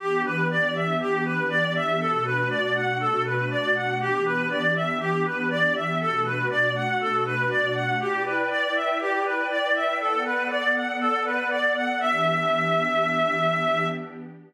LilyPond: <<
  \new Staff \with { instrumentName = "Clarinet" } { \time 4/4 \key e \dorian \tempo 4 = 120 g'8 b'8 d''8 e''8 g'8 b'8 d''8 e''8 | a'8 b'8 d''8 fis''8 a'8 b'8 d''8 fis''8 | g'8 b'8 d''8 e''8 g'8 b'8 d''8 e''8 | a'8 b'8 d''8 fis''8 a'8 b'8 d''8 fis''8 |
g'8 b'8 d''8 e''8 g'8 b'8 d''8 e''8 | a'8 b'8 d''8 fis''8 a'8 b'8 d''8 fis''8 | e''1 | }
  \new Staff \with { instrumentName = "Pad 2 (warm)" } { \time 4/4 \key e \dorian <e b d' g'>1 | <b, a d' fis'>1 | <e b d' g'>1 | <b, a d' fis'>1 |
<e' b' d'' g''>1 | <b a' d'' fis''>1 | <e b d' g'>1 | }
>>